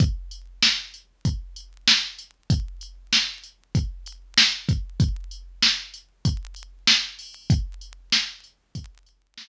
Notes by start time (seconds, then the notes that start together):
0.00 kick, closed hi-hat
0.31 closed hi-hat
0.62 snare
0.94 closed hi-hat
1.25 kick, closed hi-hat
1.56 closed hi-hat
1.88 snare
2.18 closed hi-hat
2.50 kick, closed hi-hat
2.81 closed hi-hat
3.13 snare
3.43 closed hi-hat
3.75 kick, closed hi-hat
4.06 closed hi-hat
4.38 snare
4.69 kick, closed hi-hat
5.00 kick, closed hi-hat
5.31 closed hi-hat
5.62 snare
5.94 closed hi-hat
6.25 kick, closed hi-hat
6.56 closed hi-hat
6.87 snare
7.19 open hi-hat
7.50 kick, closed hi-hat
7.81 closed hi-hat
8.12 snare
8.44 closed hi-hat
8.75 kick, closed hi-hat
9.06 closed hi-hat
9.38 snare